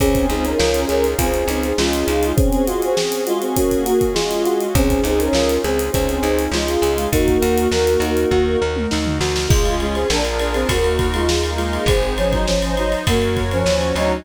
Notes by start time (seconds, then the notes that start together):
0.00 C#2 C4 C#4 D#4 F4 G#4, kick, closed hi-hat
0.15 kick, closed hi-hat
0.29 C#2 C4 D#4 G#4, closed hi-hat
0.44 C#4 A#4, closed hi-hat
0.59 C#2 F4, snare
0.74 closed hi-hat
0.88 C#2 C#4 G#4 A#4, closed hi-hat
1.04 closed hi-hat
1.18 C#2 C4 F4 G#4, kick, closed hi-hat
1.34 closed hi-hat
1.48 C#2 D#4, closed hi-hat
1.63 closed hi-hat
1.77 C#2 G#3 C#4 F4, snare
1.93 closed hi-hat
2.08 C#2 D#4, closed hi-hat
2.23 closed hi-hat
2.36 C4 C#4 F#4 G#4, kick, closed hi-hat
2.52 closed hi-hat
2.67 G#3 F4 F#4, closed hi-hat
2.82 C4 G#4, closed hi-hat
2.97 G#4, snare
3.12 closed hi-hat
3.27 G#3 F4 F#4, closed hi-hat
3.41 C4 G#4, closed hi-hat
3.56 A#3 C#4 F#4, kick, closed hi-hat
3.71 kick, closed hi-hat
3.86 F#4, closed hi-hat
4.01 kick, closed hi-hat
4.14 G#3 F4 G#4, snare
4.31 closed hi-hat
4.45 F#4, closed hi-hat
4.61 closed hi-hat
4.75 C#2 C4 C#4 D#4 F4 G#4, kick, closed hi-hat
4.90 kick, closed hi-hat
5.03 C#2 C4 D#4 G#4, closed hi-hat
5.19 C#4 A#4, closed hi-hat
5.33 C#2 F4, snare
5.49 closed hi-hat
5.64 C#2 C4 G#4, closed hi-hat
5.79 closed hi-hat
5.92 C#2 C4 C#4 G#4, kick, closed hi-hat
6.09 closed hi-hat
6.23 C#2 D#4, closed hi-hat
6.39 closed hi-hat
6.51 C#2 G#3 F4, snare
6.68 closed hi-hat
6.82 C#2 G#4, closed hi-hat
6.98 closed hi-hat
7.12 D#2 A#3 D#4 F#4 A#4, kick, closed hi-hat
7.28 kick, closed hi-hat
7.42 D#2 F#4, closed hi-hat
7.58 closed hi-hat
7.71 D#2 A#4, snare
7.87 closed hi-hat
8.00 D#2 D#4, closed hi-hat
8.17 closed hi-hat
8.31 D#2 F#4, kick
8.62 D#2 A#4
8.76 mid tom
8.91 D#2 D#4, snare
9.06 floor tom
9.21 D2 F#4, snare
9.36 snare
9.49 C#2 G#3 C#4 F4 G#4, kick, crash
9.65 ride
9.80 G#3 F4, ride
9.94 C4 G#4, ride
10.10 A#1 D4 F4 G#4 A#4, snare
10.25 ride
10.39 D4 A#4, ride
10.54 C4 G#4, ride
10.69 D#2 A#3 D#4 F#4 A#4, kick, ride
10.84 ride
10.99 kick, ride
11.14 G#3 F4, ride
11.27 A#3 D#4 A#4, snare
11.44 ride
11.57 G#3 F4, ride
11.73 ride
11.86 G#1 C4 D#4 G#4 C5, kick, ride
12.03 ride
12.18 F3 C#4, ride
12.32 F#3 D#4, kick, ride
12.47 F3 C#4 D#4 C5 D#5, snare
12.62 ride
12.77 F#3 D#4, ride
12.92 ride
13.06 F#2 A#3 F#4 A#4 C#5, kick, ride
13.22 ride
13.37 kick, ride
13.51 F3 C#4, ride
13.66 D#2 C#4 F#4 C#5, snare
13.81 ride
13.95 D2 F#3 D#4, ride